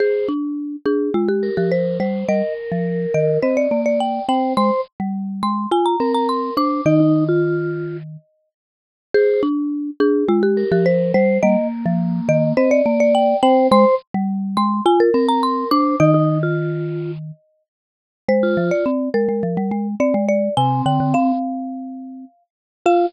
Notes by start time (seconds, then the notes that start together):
0.00 G#4 C5
0.28 D4
0.85 D4 G#4
1.14 G#3 F4
1.28 G4
1.43 A#4
1.57 F3 G4
1.72 C5
2.00 G3 C5
2.28 G3 A#4 D#5
2.72 F3
3.14 D#3 D#5
3.43 C4 C5 D#5
3.57 D5
3.71 A#3 D5
3.86 D5
4.00 G5
4.29 C4 C5 G5
4.57 G#3 C5 C6
5.00 G3
5.43 G#3 C6
5.71 F4 G#5
5.86 A#5
6.00 C4 A#4
6.14 A#5
6.29 C6
6.57 D4 C5 D6
6.86 D#3 D#4 D#5
7.00 D#4
7.29 F4
9.14 G#4 C5
9.43 D4
10.00 D4 G#4
10.28 G#3 F4
10.43 G4
10.57 A#4
10.72 F3 G4
10.86 C5
11.14 G3 C5
11.43 G3 A#3 D#5
11.86 F3
12.29 D#3 D#5
12.57 C4 C5 D#5
12.71 D5
12.86 A#3 D5
13.00 D5
13.15 G5
13.43 C4 C5 G5
13.71 G#3 C5 C6
14.14 G3
14.57 G#3 C6
14.86 F4 G#5
15.00 A#4
15.14 C4 A#4
15.28 A#5
15.43 C6
15.71 D4 C5 D6
16.00 D#3 D#4 D#5
16.14 D#4
16.43 F4
18.28 G#3 C5
18.43 F4
18.57 F3
18.71 D5
18.86 C4
19.14 G#3 A#4
19.29 G#3
19.43 F3
19.57 G3
19.71 G#3
20.00 C4 D5
20.14 G#3
20.28 D5
20.57 C3 C4 G#5
20.86 D3 G5
21.00 D3
21.14 C4 F5
22.86 F4 F5